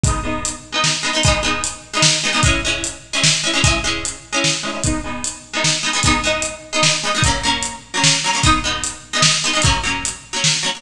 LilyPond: <<
  \new Staff \with { instrumentName = "Pizzicato Strings" } { \time 3/4 \key gis \minor \tempo 4 = 150 <gis b dis'>8 <gis b dis'>4~ <gis b dis'>16 <gis b dis'>8. <gis b dis'>16 <gis b dis'>16 | <gis b dis'>8 <gis b dis'>4~ <gis b dis'>16 <gis b dis'>8. <gis b dis'>16 <gis b dis'>16 | <gis cis' e'>8 <gis cis' e'>4~ <gis cis' e'>16 <gis cis' e'>8. <gis cis' e'>16 <gis cis' e'>16 | <gis cis' e'>8 <gis cis' e'>4~ <gis cis' e'>16 <gis cis' e'>8. <gis cis' e'>16 <gis cis' e'>16 |
<gis b dis'>8 <gis b dis'>4~ <gis b dis'>16 <gis b dis'>8. <gis b dis'>16 <gis b dis'>16 | <gis b dis'>8 <gis b dis'>4~ <gis b dis'>16 <gis b dis'>8. <gis b dis'>16 <gis b dis'>16 | <fis ais cis'>8 <fis ais cis'>4~ <fis ais cis'>16 <fis ais cis'>8. <fis ais cis'>16 <fis ais cis'>16 | <gis b dis'>8 <gis b dis'>4~ <gis b dis'>16 <gis b dis'>8. <gis b dis'>16 <gis b dis'>16 |
<fis ais cis'>8 <fis ais cis'>4~ <fis ais cis'>16 <fis ais cis'>8. <fis ais cis'>16 <fis ais cis'>16 | }
  \new DrumStaff \with { instrumentName = "Drums" } \drummode { \time 3/4 <hh bd>4 hh4 sn4 | <hh bd>4 hh4 sn4 | <hh bd>4 hh4 sn4 | <hh bd>4 hh4 sn4 |
<hh bd>4 hh4 sn4 | <hh bd>4 hh4 sn4 | <hh bd>4 hh4 sn4 | <hh bd>4 hh4 sn4 |
<hh bd>4 hh4 sn4 | }
>>